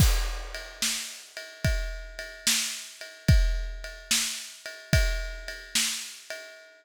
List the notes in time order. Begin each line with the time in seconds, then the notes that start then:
0.00 kick, crash
0.54 ride
0.82 snare
1.37 ride
1.64 kick, ride
2.19 ride
2.47 snare
3.01 ride
3.28 kick, ride
3.84 ride
4.11 snare
4.66 ride
4.93 kick, ride
5.48 ride
5.75 snare
6.30 ride